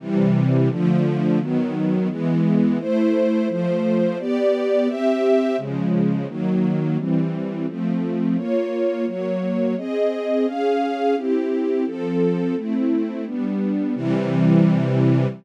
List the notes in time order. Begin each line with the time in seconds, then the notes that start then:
0.00 C3 E3 G3
0.70 D3 F3 A3
1.40 D#3 F#3 B3
2.09 E3 G#3 B3
2.79 A3 E4 C5
3.49 F3 A3 C5
4.19 B3 G4 D5
4.87 C4 G4 E5
5.58 C#3 F3 G#3
6.28 D#3 F#3 A#3
6.97 E3 G3 C4
7.68 F3 A3 C4
8.36 A#3 F4 C#5
9.06 F#3 A#3 C#5
9.77 C4 G#4 D#5
10.46 C#4 G#4 F5
11.16 C4 E4 G4
11.86 F3 C4 A4
12.56 A3 C4 E4
13.26 G3 B3 D4
13.95 C3 E3 G3